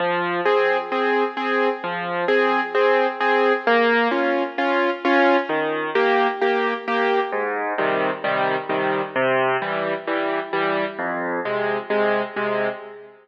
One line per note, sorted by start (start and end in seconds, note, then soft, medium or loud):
0.00 0.41 F3 loud
0.45 0.77 C4 medium
0.45 0.77 G#4 medium
0.92 1.24 C4 medium
0.92 1.24 G#4 medium
1.37 1.69 C4 medium
1.37 1.69 G#4 medium
1.84 2.25 F3 medium
2.28 2.60 C4 medium
2.28 2.60 G#4 medium
2.75 3.07 C4 medium
2.75 3.07 G#4 medium
3.21 3.53 C4 medium
3.21 3.53 G#4 medium
3.67 4.08 A#3 loud
4.11 4.43 C#4 medium
4.11 4.43 F4 medium
4.58 4.90 C#4 medium
4.58 4.90 F4 medium
5.05 5.37 C#4 medium
5.05 5.37 F4 medium
5.49 5.90 D#3 medium
5.95 6.27 A#3 medium
5.95 6.27 G4 medium
6.42 6.74 A#3 medium
6.42 6.74 G4 medium
6.88 7.20 A#3 medium
6.88 7.20 G4 medium
7.32 7.74 G#2 loud
7.78 8.10 C3 medium
7.78 8.10 D#3 medium
7.78 8.10 G3 medium
8.24 8.56 C3 medium
8.24 8.56 D#3 medium
8.24 8.56 G3 medium
8.69 9.01 C3 medium
8.69 9.01 D#3 medium
8.69 9.01 G3 medium
9.16 9.57 C3 loud
9.62 9.94 E3 medium
9.62 9.94 G3 medium
10.07 10.40 E3 medium
10.07 10.40 G3 medium
10.53 10.85 E3 medium
10.53 10.85 G3 medium
10.99 11.40 F2 loud
11.45 11.77 C3 medium
11.45 11.77 G#3 medium
11.90 12.22 C3 medium
11.90 12.22 G#3 medium
12.36 12.68 C3 medium
12.36 12.68 G#3 medium